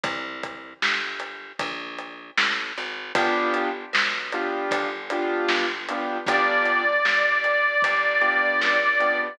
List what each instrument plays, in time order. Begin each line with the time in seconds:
0.03 electric bass (finger) C2, kick, closed hi-hat
0.43 kick, closed hi-hat
0.82 electric bass (finger) G1, snare
1.20 closed hi-hat
1.59 electric bass (finger) A#1, kick, closed hi-hat
1.98 closed hi-hat
2.38 electric bass (finger) A1, snare
2.77 electric bass (finger) G#1, closed hi-hat
3.15 electric bass (finger) G1, acoustic grand piano B3 D4 F4 G4, kick, closed hi-hat
3.54 closed hi-hat
3.93 electric bass (finger) B1, snare
4.32 acoustic grand piano B3 D4 F4 G4, closed hi-hat
4.71 electric bass (finger) G1, kick, closed hi-hat
5.10 acoustic grand piano B3 D4 F4 G4, closed hi-hat
5.48 electric bass (finger) G1, snare
5.88 acoustic grand piano B3 D4 F4 G4, closed hi-hat
6.26 electric bass (finger) G1, acoustic grand piano B3 D4 F4 G4, harmonica D5, kick, closed hi-hat
6.65 closed hi-hat
7.05 electric bass (finger) G1, snare
7.44 closed hi-hat
7.82 electric bass (finger) G1, kick, closed hi-hat
8.21 acoustic grand piano B3 D4 F4 G4, closed hi-hat
8.61 electric bass (finger) C#2, snare
9.00 acoustic grand piano B3 D4 F4 G4, closed hi-hat